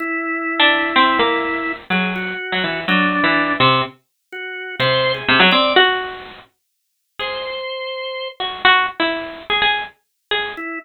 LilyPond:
<<
  \new Staff \with { instrumentName = "Harpsichord" } { \time 6/4 \tempo 4 = 125 r4 r16 d'8. c'8 ais4. fis4 r16 fis16 e8 | fis8. e8. c8 r2 c4 c16 fis16 c'8 | fis'4. r4. gis'4 r4. fis'8 | fis'8 r16 e'4 gis'16 gis'8 r4 gis'8 r2 | }
  \new Staff \with { instrumentName = "Drawbar Organ" } { \time 6/4 e'1 gis'8 fis'4. | d'4. r4. fis'4 c''8. gis'8. d''8 | r2. c''2~ c''8 r8 | r1 e'8 r4. | }
>>